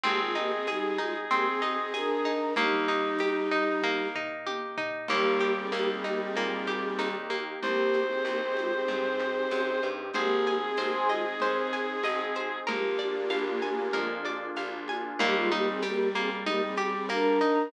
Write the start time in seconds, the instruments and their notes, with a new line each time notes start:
0.04 electric bass (finger) G#1, choir aahs A#3 G4, orchestral harp C4, clarinet G#4, low conga, shaker
0.20 choir aahs G#3 F4
0.35 choir aahs A#3 G4, orchestral harp D#4, shaker
0.52 choir aahs C4 G#4
0.67 choir aahs G3 D#4, orchestral harp G#4, tambourine, high conga, shaker
0.98 choir aahs G#3 F4, orchestral harp D#4, high conga, shaker
1.31 choir aahs A#3 G4, orchestral harp C4, low conga, shaker
1.46 choir aahs C4 G#4
1.61 choir aahs C4 G#4, orchestral harp D#4, high conga, shaker
1.78 choir aahs C4 G#4
1.94 choir aahs D4 A#4, orchestral harp G#4, tambourine, high conga, shaker
2.25 orchestral harp D#4, shaker
2.56 electric bass (finger) D#2, choir aahs G3 D#4, orchestral harp A#3, clarinet D#4, low conga, shaker
2.88 orchestral harp D#4, shaker
3.19 orchestral harp G4, tambourine, high conga, shaker
3.51 orchestral harp D#4, shaker
3.82 orchestral harp A#3, kick, high tom
4.15 orchestral harp D#4, floor tom
4.47 orchestral harp G4, high tom
4.78 orchestral harp D#4, floor tom
5.08 electric bass (finger) D#2, clarinet G3, pad 2 (warm) A#3 D#4 G4, choir aahs A#3 G4, orchestral harp A#3, crash, low conga, shaker
5.40 orchestral harp G4, high conga, shaker
5.57 choir aahs C4 G#4
5.72 electric bass (finger) D#2, orchestral harp A#3, choir aahs A#3 G4, tambourine, high conga, shaker
5.88 choir aahs C4 G#4
6.04 choir aahs A#3 G4, orchestral harp D#4, high conga, shaker
6.20 choir aahs C4 G#4
6.36 electric bass (finger) A#2, orchestral harp A#3, low conga, shaker
6.67 orchestral harp G4, snare, high conga, shaker
6.98 electric bass (finger) D#2, orchestral harp D#4, tambourine, high conga, shaker
7.30 orchestral harp A#3, high conga, shaker
7.62 electric bass (finger) C2, choir aahs A#3 G4, pad 2 (warm) C4 D#4 G4, clarinet C5, low conga, shaker
7.93 high conga, shaker
8.09 choir aahs C4 G#4
8.25 electric bass (finger) C2, choir aahs A#3 G4, tambourine, high conga, shaker
8.42 choir aahs C4 G#4
8.57 choir aahs G#3 F4, high conga, shaker
8.73 choir aahs C4 G#4
8.88 electric bass (finger) G2, low conga, shaker
9.19 snare, high conga, shaker
9.51 electric bass (finger) F#2, tambourine, high conga, shaker
9.82 electric bass (finger) G2, shaker
10.13 electric bass (finger) G#1, choir aahs A#3 G4, pad 2 (warm) C4 D#4 G#4, clarinet G#4, orchestral harp C5, low conga, shaker
10.46 orchestral harp G#5, high conga, shaker
10.63 choir aahs C4 G#4
10.77 electric bass (finger) G#1, choir aahs A#3 G4, orchestral harp C5, tambourine, high conga, shaker
10.93 choir aahs C5 G#5
11.09 choir aahs G#3 F4, orchestral harp D#5, high conga, shaker
11.25 choir aahs C4 G#4
11.40 electric bass (finger) D#2, orchestral harp C5, low conga, shaker
11.73 orchestral harp G#5, snare, shaker
12.03 electric bass (finger) G#1, orchestral harp D#5, tambourine, high conga, shaker
12.34 orchestral harp C5, high conga, shaker
12.67 electric bass (finger) A#1, choir aahs A#3 G4, pad 2 (warm) A#3 D4 F4 G#4, clarinet A#3, orchestral harp A#4, low conga, shaker
12.99 orchestral harp D5, high conga, shaker
13.30 electric bass (finger) A#1, orchestral harp F5, tambourine, high conga, shaker
13.62 orchestral harp G#5, high conga, shaker
13.93 electric bass (finger) F2, orchestral harp A#4, low conga, shaker
14.25 orchestral harp D5, snare, high conga, shaker
14.56 electric bass (finger) A#1, orchestral harp F5, tambourine, high conga, shaker
14.88 orchestral harp G#5, high conga, shaker
15.19 electric bass (finger) D#2, clarinet G3, choir aahs A#3 G4, orchestral harp A#3, low conga, shaker
15.36 choir aahs G#3 F4
15.52 choir aahs A#3 G4, orchestral harp D#4, high conga, shaker
15.68 choir aahs C4 G#4
15.82 choir aahs A#3 G4, orchestral harp G4, tambourine, high conga, shaker
16.15 orchestral harp A#3, choir aahs C4 G#4, high conga, shaker
16.46 choir aahs A#3 G4, orchestral harp D#4, low conga, shaker
16.63 choir aahs C4 G#4
16.76 choir aahs C4 G#4, orchestral harp G4, high conga, shaker
16.94 choir aahs C4 G#4
17.09 orchestral harp A#3, choir aahs D4 A#4, tambourine, high conga, shaker
17.41 orchestral harp D#4, shaker